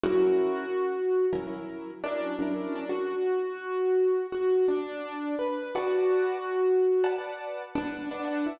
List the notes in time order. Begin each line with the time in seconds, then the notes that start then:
0.03 F#3 C#4 E4 F#4 A#4
1.33 F#3 C#4 E4 A#4
1.47 F#3 C#4 E4 A#4
2.04 F#3 C#4 D4 E4 A#4
2.39 F#3 C#4 D4 E4 A#4
2.54 F#3 C#4 E4 A#4
2.75 D4
2.89 F#4
4.32 F#4
4.68 D4
5.39 B4
5.75 F#4 B4 D5 F#5 A5
7.04 B4 D5 F#5 A5
7.18 B4 D5 F#5 A5
7.75 D4 B4 D5 F#5 A5
8.11 D4 B4 D5 F#5 A5
8.25 B4 D5 F#5 A5
8.46 E4